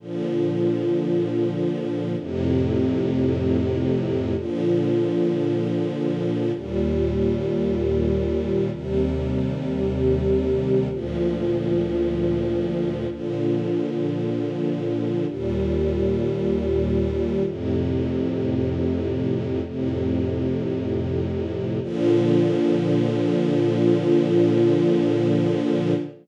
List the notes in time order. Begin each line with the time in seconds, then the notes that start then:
0.00 A#2 D3 F3
2.19 F2 A2 C3
4.36 A#2 D3 F3
6.54 D#2 A#2 G3
8.72 D#2 C3 G3
10.91 D2 A#2 F3
13.10 A#2 D3 F3
15.27 D#2 A#2 G3
17.45 F2 A2 C3
19.63 F2 A2 C3
21.82 A#2 D3 F3